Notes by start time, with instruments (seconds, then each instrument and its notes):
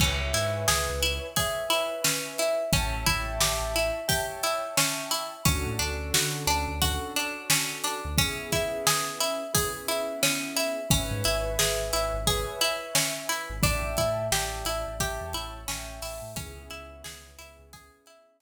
0.00 synth bass 2 C#2, pizzicato strings C#4, acoustic grand piano B4 C#5 E5 G#5, kick, crash
0.33 synth bass 2 G#2, pizzicato strings E4, snare, closed hi-hat
0.68 synth bass 2 C#2, pizzicato strings G#4, snare
0.89 synth bass 2 C#2
1.03 pizzicato strings E4, closed hi-hat
1.36 pizzicato strings G#4, acoustic grand piano B4 C#5 E5 G#5, kick, closed hi-hat
1.70 pizzicato strings E4, closed hi-hat
2.04 pizzicato strings C#4, snare
2.38 pizzicato strings E4, closed hi-hat
2.72 synth bass 2 A1, pizzicato strings C#4, acoustic grand piano C#5 E5 G5 A5, kick, closed hi-hat
3.06 synth bass 2 A1, pizzicato strings E4, kick, closed hi-hat
3.40 synth bass 2 A1, pizzicato strings G4, snare
3.61 synth bass 2 A1
3.76 pizzicato strings E4, closed hi-hat
4.08 pizzicato strings G4, acoustic grand piano C#5 E5 G5 A5, kick, closed hi-hat
4.43 pizzicato strings E4, closed hi-hat
4.77 pizzicato strings C#4, snare
5.11 pizzicato strings E4, closed hi-hat
5.45 synth bass 2 D2, pizzicato strings C#4, acoustic grand piano C#4 D4 F#4 A4, kick, closed hi-hat
5.66 synth bass 2 A2
5.79 synth bass 2 D2, pizzicato strings D4, snare, closed hi-hat
6.13 synth bass 2 D3, pizzicato strings F#4, snare
6.47 synth bass 2 D2, pizzicato strings D4, closed hi-hat
6.68 synth bass 2 D2
6.82 acoustic grand piano C#4 D4 F#4 A4, pizzicato strings F#4, kick, closed hi-hat
7.16 pizzicato strings D4, closed hi-hat
7.50 pizzicato strings C#4, snare
7.84 pizzicato strings D4, closed hi-hat
8.05 synth bass 2 D2
8.18 acoustic grand piano B3 C#4 E4 G#4, pizzicato strings C#4, kick, closed hi-hat
8.52 pizzicato strings E4, kick, closed hi-hat
8.87 pizzicato strings G#4, snare
9.20 pizzicato strings E4, closed hi-hat
9.54 acoustic grand piano B3 C#4 E4 G#4, pizzicato strings G#4, kick, closed hi-hat
9.88 pizzicato strings E4, closed hi-hat
10.23 pizzicato strings C#4, snare
10.57 pizzicato strings E4, closed hi-hat
10.90 synth bass 2 G#1, pizzicato strings C#4, acoustic grand piano B4 C#5 E5 G#5, kick, closed hi-hat
11.11 synth bass 2 G#2
11.24 synth bass 2 G#1, pizzicato strings E4, closed hi-hat
11.59 synth bass 2 G#1, pizzicato strings G#4, snare
11.93 synth bass 2 G#1, pizzicato strings E4, closed hi-hat
12.14 synth bass 2 G#1
12.27 pizzicato strings G#4, acoustic grand piano B4 C#5 E5 G#5, kick, closed hi-hat
12.61 pizzicato strings E4, closed hi-hat
12.95 pizzicato strings C#4, snare
13.29 pizzicato strings E4, closed hi-hat
13.50 synth bass 2 G#1
13.63 synth bass 2 A1, pizzicato strings D4, acoustic grand piano D5 E5 G5 A5, kick, closed hi-hat
13.84 synth bass 2 A1
13.97 synth bass 2 A2, pizzicato strings E4, kick, closed hi-hat
14.32 synth bass 2 A1, pizzicato strings G4, acoustic grand piano D5 E5 G5 A5, snare
14.65 synth bass 2 A1, pizzicato strings E4, closed hi-hat
14.87 synth bass 2 A1
15.00 synth bass 2 A1, pizzicato strings G4, acoustic grand piano C#5 E5 G5 A5, kick, closed hi-hat
15.21 synth bass 2 E2
15.33 synth bass 2 A1, pizzicato strings E4, closed hi-hat
15.68 synth bass 2 A1, pizzicato strings C#4, acoustic grand piano C#5 E5 G5 A5, snare
16.02 synth bass 2 A1, pizzicato strings E4, open hi-hat
16.22 synth bass 2 A2
16.36 synth bass 2 C#2, acoustic grand piano B3 C#4 E4 G#4, pizzicato strings C#4, kick, closed hi-hat
16.57 synth bass 2 C#2
16.70 synth bass 2 C#2, pizzicato strings E4, closed hi-hat
17.04 synth bass 2 C#2, pizzicato strings G#4, snare
17.38 synth bass 2 C#2, pizzicato strings E4, closed hi-hat
17.59 synth bass 2 C#2
17.73 pizzicato strings G#4, kick, closed hi-hat
18.06 pizzicato strings E4, closed hi-hat
18.40 pizzicato strings C#4, snare